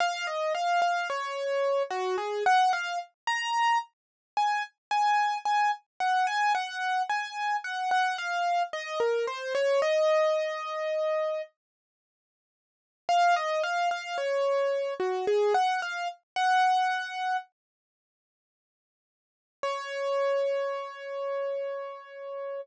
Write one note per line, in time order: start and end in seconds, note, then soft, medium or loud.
0.00 0.26 F5 loud
0.27 0.53 D#5 medium
0.55 0.80 F5 loud
0.82 1.08 F5 loud
1.10 1.83 C#5 loud
1.90 2.16 F#4 loud
2.18 2.44 G#4 medium
2.46 2.72 F#5 loud
2.73 2.99 F5 loud
3.27 3.78 A#5 loud
4.37 4.63 G#5 loud
4.91 5.38 G#5 loud
5.45 5.71 G#5 loud
6.00 6.26 F#5 loud
6.27 6.53 G#5 loud
6.55 7.02 F#5 loud
7.10 7.57 G#5 loud
7.64 7.90 F#5 medium
7.91 8.17 F#5 loud
8.18 8.63 F5 loud
8.73 8.99 D#5 loud
9.00 9.26 A#4 medium
9.27 9.53 C5 loud
9.55 9.81 C#5 loud
9.82 11.42 D#5 loud
13.09 13.35 F5 loud
13.36 13.62 D#5 loud
13.63 13.89 F5 loud
13.91 14.17 F5 loud
14.18 14.94 C#5 medium
15.00 15.26 F#4 medium
15.27 15.53 G#4 loud
15.54 15.80 F#5 loud
15.82 16.08 F5 medium
16.36 17.37 F#5 loud
19.63 22.61 C#5 loud